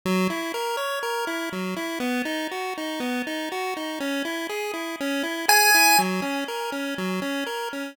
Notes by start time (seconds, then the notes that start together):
0.05 F#3
0.30 E4
0.54 A#4
0.77 C#5
1.03 A#4
1.27 E4
1.52 F#3
1.77 E4
2.00 B3
2.25 D#4
2.51 F#4
2.78 D#4
3.00 B3
3.27 D#4
3.52 F#4
3.77 D#4
4.00 C#4
4.25 E4
4.49 G#4
4.74 E4
5.01 C#4
5.23 E4
5.48 G#4 G#5
5.74 E4
5.98 F#3
6.22 C#4
6.48 A#4
6.72 C#4
6.98 F#3
7.22 C#4
7.46 A#4
7.73 C#4